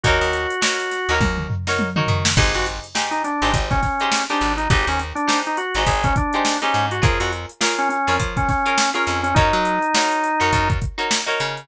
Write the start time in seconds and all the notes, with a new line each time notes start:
0.04 D#2 D#4 F#4 A#4 C#5, kick, closed hi-hat
0.21 D#2, closed hi-hat
0.33 snare, closed hi-hat
0.50 closed hi-hat
0.61 D#4 F#4 A#4 C#5, snare
0.79 closed hi-hat
0.91 snare, closed hi-hat
1.09 D#2 D#4 F#4 A#4 C#5, closed hi-hat
1.21 D#2, kick, high tom
1.38 mid tom
1.50 floor tom
1.67 D#4 F#4 A#4 C#5, snare
1.79 high tom
1.96 D#4 F#4 A#4 C#5, mid tom
2.08 D#3, floor tom
2.25 snare
2.37 G#1 D#4 G4 G#4 C5, kick, crash
2.54 G#1 F#4, closed hi-hat
2.66 closed hi-hat
2.84 closed hi-hat
2.95 D#4 G4 G#4 C5, snare
3.11 D#4, closed hi-hat
3.24 D4, closed hi-hat
3.42 G#1 D#4 G4 G#4 C5, closed hi-hat
3.54 G#1, kick, closed hi-hat
3.71 C#4, kick, snare, closed hi-hat
3.82 C#4, kick, snare, closed hi-hat
4.00 D#4 G4 G#4 C5, closed hi-hat
4.12 snare
4.29 D4 D#4 G4 G#4 C5, snare, closed hi-hat
4.41 G#1, closed hi-hat
4.57 D#4, closed hi-hat
4.70 G#1 D#4 G4 G#4 C5, kick, closed hi-hat
4.87 D#2 C#4, closed hi-hat
4.99 closed hi-hat
5.15 D4, closed hi-hat
5.27 D#4 G4 G#4 C5, snare
5.46 D#4, closed hi-hat
5.57 F#4, closed hi-hat
5.74 G#1 D#4 G4 G#4 C5, closed hi-hat
5.86 G#1 G#4, kick, closed hi-hat
6.04 C#4, kick, closed hi-hat
6.16 D4, kick, closed hi-hat
6.33 D#4 G4 G#4 C5, closed hi-hat
6.45 snare
6.62 C#4 D#4 G4 G#4 C5, snare, closed hi-hat
6.74 G#2, closed hi-hat
6.91 F#4, closed hi-hat
7.02 F2 F4 G#4 A#4 C#5, kick, closed hi-hat
7.20 F2 F#4, closed hi-hat
7.32 closed hi-hat
7.49 closed hi-hat
7.61 F4 G#4 A#4 C#5, snare
7.78 C#4, closed hi-hat
7.89 C#4, closed hi-hat
8.07 F2 F4 G#4 A#4 C#5, snare, closed hi-hat
8.20 F3, kick, closed hi-hat
8.37 C#4, kick, closed hi-hat
8.48 C#4, kick, snare, closed hi-hat
8.66 F4 G#4 A#4 C#5, closed hi-hat
8.78 snare
8.94 C#4 F4 G#4 A#4 C#5, closed hi-hat
9.07 F2, snare, closed hi-hat
9.23 C#4, closed hi-hat
9.35 F#2 D#4 F#4 A#4 C#5, kick, closed hi-hat
9.53 F#3, snare, closed hi-hat
9.65 closed hi-hat
9.82 closed hi-hat
9.94 D#4 F#4 A#4 C#5, snare
10.11 closed hi-hat
10.24 closed hi-hat
10.40 F#2 D#4 F#4 A#4 C#5, closed hi-hat
10.53 F#2, kick, closed hi-hat
10.70 kick, closed hi-hat
10.81 kick, closed hi-hat
10.98 D#4 F#4 A#4 C#5, closed hi-hat
11.11 snare
11.26 D#4 F#4 A#4 C#5, closed hi-hat
11.40 C#3, snare, closed hi-hat
11.57 closed hi-hat